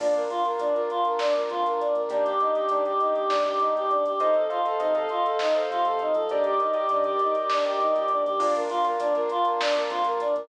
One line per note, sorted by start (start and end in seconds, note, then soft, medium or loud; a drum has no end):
0.00 0.27 A#1 medium
0.00 0.24 A#3 loud
0.00 0.14 D4 medium
0.00 0.24 D4 loud
0.00 0.24 F4 medium
0.00 kick loud
0.00 crash loud
0.14 0.29 A#4 medium
0.14 closed hi-hat medium
0.30 0.42 A#3 loud
0.30 0.42 D4 medium
0.30 0.44 F4 medium
0.30 0.42 F4 medium
0.30 closed hi-hat medium
0.45 0.57 A#3 medium
0.45 0.57 D4 medium
0.45 0.57 F4 medium
0.45 0.59 A#4 medium
0.45 closed hi-hat medium
0.59 0.86 A#1 medium
0.59 0.72 A#3 medium
0.59 0.72 D4 medium
0.59 0.74 D4 medium
0.59 0.72 F4 medium
0.59 closed hi-hat loud
0.74 1.23 A#3 medium
0.74 1.23 D4 medium
0.74 1.23 F4 medium
0.74 0.88 A#4 medium
0.74 closed hi-hat medium
0.90 1.04 F4 medium
0.90 closed hi-hat medium
1.05 1.19 A#4 medium
1.05 closed hi-hat medium
1.19 1.33 D4 loud
1.19 snare loud
1.35 1.84 A#3 medium
1.35 1.84 D4 medium
1.35 1.84 F4 medium
1.35 1.49 A#4 medium
1.35 closed hi-hat medium
1.49 1.64 F2 medium
1.49 1.64 F4 medium
1.49 closed hi-hat medium
1.65 1.92 A#1 medium
1.65 1.79 A#4 medium
1.65 closed hi-hat medium
1.80 1.94 D4 medium
1.80 closed hi-hat medium
1.94 2.07 A#2 medium
1.94 2.09 A#4 medium
1.94 closed hi-hat medium
2.09 2.37 D#2 medium
2.09 2.34 A#3 loud
2.09 2.24 D4 medium
2.09 2.34 D4 loud
2.09 2.34 D#4 loud
2.09 2.34 G4 loud
2.09 kick loud
2.09 closed hi-hat loud
2.24 2.38 G4 medium
2.24 closed hi-hat medium
2.40 2.52 A#3 medium
2.40 2.52 D4 medium
2.40 2.52 D#4 medium
2.40 2.54 D#4 medium
2.40 2.52 G4 medium
2.40 closed hi-hat medium
2.55 2.68 A#3 medium
2.55 2.68 D4 medium
2.55 2.68 D#4 loud
2.55 2.69 G4 medium
2.55 2.68 G4 medium
2.55 closed hi-hat medium
2.69 2.97 D#2 medium
2.69 2.83 A#3 loud
2.69 2.84 D4 medium
2.69 2.83 D4 medium
2.69 2.83 D#4 medium
2.69 2.83 G4 loud
2.69 closed hi-hat loud
2.85 3.34 A#3 medium
2.85 3.34 D4 medium
2.85 3.34 D#4 medium
2.85 2.99 G4 medium
2.85 3.34 G4 medium
2.85 closed hi-hat medium
3.00 3.13 D#4 medium
3.00 closed hi-hat medium
3.15 3.29 G4 medium
3.15 closed hi-hat medium
3.29 3.71 D#2 medium
3.29 3.43 D4 medium
3.29 snare loud
3.45 3.94 A#3 medium
3.45 3.94 D4 medium
3.45 3.94 D#4 loud
3.45 3.59 G4 medium
3.45 3.94 G4 medium
3.45 closed hi-hat medium
3.60 3.73 D#4 medium
3.60 closed hi-hat medium
3.75 4.16 E2 medium
3.75 3.90 G4 medium
3.75 closed hi-hat medium
3.90 4.04 D4 medium
3.90 closed hi-hat medium
4.05 4.19 G4 medium
4.05 closed hi-hat medium
4.20 4.48 F2 medium
4.20 4.34 D#4 loud
4.20 4.45 A4 loud
4.20 4.45 C5 loud
4.20 4.45 D#5 loud
4.20 4.45 F5 medium
4.20 kick loud
4.20 closed hi-hat loud
4.34 4.49 A4 medium
4.34 closed hi-hat medium
4.49 4.63 F4 medium
4.49 4.62 A4 medium
4.49 4.62 C5 medium
4.49 4.62 D#5 medium
4.49 4.62 F5 medium
4.49 closed hi-hat medium
4.65 4.79 A4 medium
4.65 4.77 A4 medium
4.65 4.77 C5 medium
4.65 4.77 D#5 loud
4.65 4.77 F5 medium
4.65 closed hi-hat medium
4.80 5.07 C3 medium
4.80 4.94 D#4 medium
4.80 4.92 A4 medium
4.80 4.92 C5 medium
4.80 4.92 D#5 medium
4.80 4.92 F5 medium
4.80 closed hi-hat loud
4.95 5.43 A4 medium
4.95 5.09 A4 medium
4.95 5.43 C5 medium
4.95 5.43 D#5 loud
4.95 5.43 F5 medium
4.95 closed hi-hat medium
5.09 5.23 F4 medium
5.09 closed hi-hat medium
5.25 5.38 A4 medium
5.25 closed hi-hat medium
5.39 5.54 D#4 loud
5.39 snare loud
5.55 5.69 A4 medium
5.55 6.03 A4 medium
5.55 6.03 C5 medium
5.55 6.03 D#5 medium
5.55 6.03 F5 loud
5.55 closed hi-hat medium
5.70 5.84 C3 medium
5.70 5.84 F4 medium
5.70 closed hi-hat medium
5.85 6.12 C3 medium
5.85 5.99 A4 medium
5.85 closed hi-hat medium
5.99 6.14 D#4 medium
5.99 closed hi-hat medium
6.14 6.28 F3 medium
6.14 6.29 A4 medium
6.14 closed hi-hat medium
6.29 6.58 D#2 medium
6.29 6.44 D4 medium
6.29 6.55 G4 loud
6.29 6.55 A#4 loud
6.29 6.55 D5 loud
6.29 6.55 D#5 medium
6.29 kick loud
6.29 closed hi-hat medium
6.44 6.58 G4 medium
6.44 closed hi-hat medium
6.59 6.74 D#4 medium
6.59 6.71 G4 medium
6.59 6.71 A#4 medium
6.59 6.71 D5 medium
6.59 6.71 D#5 medium
6.59 closed hi-hat medium
6.74 6.86 G4 medium
6.74 6.89 G4 medium
6.74 6.86 A#4 medium
6.74 6.86 D5 medium
6.74 6.86 D#5 medium
6.74 closed hi-hat medium
6.89 7.17 D#3 medium
6.89 7.04 D4 medium
6.89 7.03 G4 medium
6.89 7.03 A#4 medium
6.89 7.03 D5 medium
6.89 7.03 D#5 medium
6.89 closed hi-hat loud
7.04 7.53 G4 medium
7.04 7.20 G4 medium
7.04 7.53 A#4 medium
7.04 7.53 D5 medium
7.04 7.53 D#5 medium
7.04 closed hi-hat medium
7.19 7.35 D#4 medium
7.19 closed hi-hat medium
7.35 7.49 G4 medium
7.35 closed hi-hat medium
7.50 7.64 D4 medium
7.50 snare loud
7.65 8.13 G4 medium
7.65 7.79 G4 medium
7.65 8.13 A#4 medium
7.65 8.13 D5 medium
7.65 8.13 D#5 medium
7.65 closed hi-hat medium
7.79 7.92 D#2 medium
7.79 7.94 D#4 medium
7.79 closed hi-hat medium
7.95 8.22 A#2 medium
7.95 8.08 G4 medium
7.95 closed hi-hat medium
8.08 8.24 D4 medium
8.08 closed hi-hat medium
8.25 8.39 D#2 medium
8.25 8.39 G4 medium
8.25 closed hi-hat medium
8.40 8.68 A#1 loud
8.40 8.64 A#3 loud
8.40 8.64 D4 loud
8.40 8.54 D4 loud
8.40 8.64 F4 loud
8.40 kick loud
8.40 crash loud
8.55 8.69 A#4 medium
8.55 closed hi-hat loud
8.69 8.83 A#3 loud
8.69 8.83 D4 loud
8.69 8.83 F4 medium
8.69 8.83 F4 loud
8.69 closed hi-hat loud
8.84 8.96 A#3 loud
8.84 8.96 D4 loud
8.84 8.96 F4 loud
8.84 8.98 A#4 medium
8.84 closed hi-hat loud
8.99 9.26 A#1 medium
8.99 9.12 A#3 loud
8.99 9.14 D4 medium
8.99 9.12 D4 loud
8.99 9.12 F4 loud
8.99 closed hi-hat loud
9.14 9.62 A#3 loud
9.14 9.62 D4 loud
9.14 9.62 F4 loud
9.14 9.28 A#4 medium
9.14 closed hi-hat medium
9.29 9.45 F4 loud
9.29 closed hi-hat loud
9.45 9.59 A#4 medium
9.45 closed hi-hat medium
9.60 9.74 D4 loud
9.60 snare loud
9.75 10.23 A#3 loud
9.75 10.23 D4 loud
9.75 10.23 F4 loud
9.75 9.89 A#4 medium
9.75 closed hi-hat loud
9.90 10.04 F2 loud
9.90 10.04 F4 medium
9.90 closed hi-hat loud
10.04 10.33 A#1 medium
10.04 10.19 A#4 medium
10.04 closed hi-hat loud
10.20 10.34 D4 medium
10.20 closed hi-hat loud
10.35 10.48 A#2 medium
10.35 10.48 A#4 medium
10.35 closed hi-hat medium